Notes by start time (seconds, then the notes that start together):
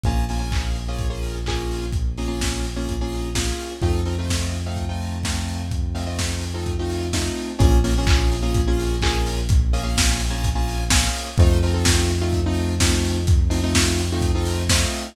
0.03 A#1 A#3 C#4 F4 G#4, kick, closed hi-hat
0.29 A#3 C#4 F4 G#4, open hi-hat
0.39 A#3 C#4 F4 G#4
0.52 kick, clap
0.75 open hi-hat
0.88 A#3 C#4 F4 G#4
0.99 kick, closed hi-hat
1.10 A#3 C#4 F4 G#4
1.23 open hi-hat
1.46 A#3 C#4 F4 G#4, kick, clap
1.71 open hi-hat
1.92 kick, closed hi-hat
2.18 A#3 C#4 F4 G#4, open hi-hat
2.27 A#3 C#4 F4 G#4
2.41 kick, snare
2.64 open hi-hat
2.76 A#3 C#4 F4 G#4
2.89 kick, closed hi-hat
3.01 A#3 C#4 F4 G#4
3.12 open hi-hat
3.35 A#3 C#4 F4 G#4, kick, snare
3.60 open hi-hat
3.82 F2 A3 C4 D#4 F4, kick, closed hi-hat
4.05 A3 C4 D#4 F4, open hi-hat
4.18 A3 C4 D#4 F4
4.29 kick, snare
4.54 open hi-hat
4.66 A3 C4 D#4 F4
4.76 kick, closed hi-hat
4.89 A3 C4 D#4 F4
5.02 open hi-hat
5.23 A3 C4 D#4 F4, kick, snare
5.48 open hi-hat
5.71 kick, closed hi-hat
5.94 A3 C4 D#4 F4, open hi-hat
6.06 A3 C4 D#4 F4
6.19 kick, snare
6.41 open hi-hat
6.54 A3 C4 D#4 F4
6.66 kick, closed hi-hat
6.79 A3 C4 D#4 F4
6.90 open hi-hat
7.13 A3 C4 D#4 F4, kick, snare
7.36 open hi-hat
7.59 A#1 A#3 C#4 F4 G#4, kick, closed hi-hat
7.84 A#3 C#4 F4 G#4, open hi-hat
7.98 A#3 C#4 F4 G#4
8.07 kick, clap
8.32 open hi-hat
8.42 A#3 C#4 F4 G#4
8.54 kick, closed hi-hat
8.67 A#3 C#4 F4 G#4
8.80 open hi-hat
9.02 A#3 C#4 F4 G#4, kick, clap
9.26 open hi-hat
9.49 kick, closed hi-hat
9.73 A#3 C#4 F4 G#4, open hi-hat
9.83 A#3 C#4 F4 G#4
9.97 kick, snare
10.20 open hi-hat
10.30 A#3 C#4 F4 G#4
10.44 kick, closed hi-hat
10.55 A#3 C#4 F4 G#4
10.68 open hi-hat
10.90 A#3 C#4 F4 G#4, kick, snare
11.14 open hi-hat
11.38 F2 A3 C4 D#4 F4, kick, closed hi-hat
11.63 A3 C4 D#4 F4, open hi-hat
11.74 A3 C4 D#4 F4
11.85 kick, snare
12.09 open hi-hat
12.21 A3 C4 D#4 F4
12.33 kick, closed hi-hat
12.46 A3 C4 D#4 F4
12.56 open hi-hat
12.80 A3 C4 D#4 F4, kick, snare
13.04 open hi-hat
13.27 kick, closed hi-hat
13.50 A3 C4 D#4 F4, open hi-hat
13.63 A3 C4 D#4 F4
13.74 kick, snare
13.98 open hi-hat
14.12 A3 C4 D#4 F4
14.22 kick, closed hi-hat
14.35 A3 C4 D#4 F4
14.45 open hi-hat
14.69 A3 C4 D#4 F4, kick, snare
14.94 open hi-hat